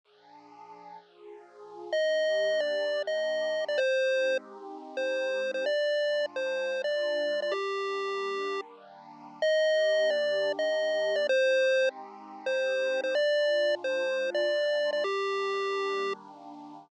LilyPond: <<
  \new Staff \with { instrumentName = "Lead 1 (square)" } { \time 4/4 \key ees \major \tempo 4 = 128 r1 | ees''4. d''4 ees''4~ ees''16 d''16 | c''4. r4 c''4~ c''16 c''16 | d''4. c''4 d''4~ d''16 d''16 |
g'2~ g'8 r4. | ees''4. d''4 ees''4~ ees''16 d''16 | c''4. r4 c''4~ c''16 c''16 | d''4. c''4 d''4~ d''16 d''16 |
g'2~ g'8 r4. | }
  \new Staff \with { instrumentName = "Pad 2 (warm)" } { \time 4/4 \key ees \major <bes, f d' aes'>2 <bes, f f' aes'>2 | <ees bes d' g'>1 | <aes c' ees' g'>1 | <bes, aes d' f'>1 |
<ees g bes d'>1 | <ees bes d' g'>1 | <aes c' ees' g'>1 | <bes, aes d' f'>1 |
<ees g bes d'>1 | }
>>